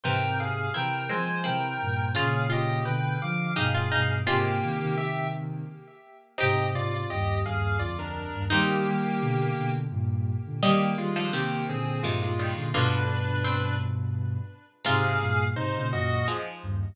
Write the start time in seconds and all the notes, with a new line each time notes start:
0.04 G#2 C3 E3 A#4 C5 G5
0.40 G#4 F5
0.74 C3 E3 C4 E4 A#4 G5
1.09 F3 G#3 C4 C5 G#5
1.44 C3 E3 C4 E4 A#4 G5
1.81 G2 A#2
2.15 A#2 C#3 C#4 F4 G#4 F5
2.50 F4 G4 D#5
2.85 B2 D3 B4 G5
3.22 D3 F3 F5 D6
3.56 G2 B2 D#4 G4 G#4 F5
3.75 F4
3.91 G2 B2 D#4
4.26 G#2 C3 G#3 A#3 C4 F4 G4
4.63 C3 D#3
4.81 C3 D#3
4.97 G4 E5
6.38 G#2 C3 C4 D#4 G4 D#5
6.72 G#2 C3 F4 D5
6.94 F4 D5
7.10 D#2 G2 G4 D#5
7.45 D#2 G2 G#4 F5
7.79 D2 F2 F4 D5
7.99 D4 A#4
8.33 D#2 G2
8.50 D#3 G3 A#3 C4 D#4 G4
8.87 D#3 G3
9.21 B2 D3
9.57 B2 D3
9.90 G2 A#2
10.46 A#2 D3
10.62 D#3 G3 A#3 G4 D#5
10.98 D#3 G3 G#3 F4
11.16 D3 F3 G#3 F4
11.33 C3 D#3 A#3 G4
11.68 A#2 D3 C4 G#4
12.02 G2 A#2 C3 D#3 G#3 F4
12.22 G#3 F4
12.39 D#3 G3
12.56 A#2 D3
12.73 G2 B2 D3 D4 F4 B4
13.44 C4
14.85 G#2 C3 F4 G#4 F5
15.20 G2 A#2
15.55 G#2 C3 D#4 C5
15.76 A#2 C#3
15.92 F#2 A#2 F#4 D#5
16.28 F3 G#3
16.63 D#2 G2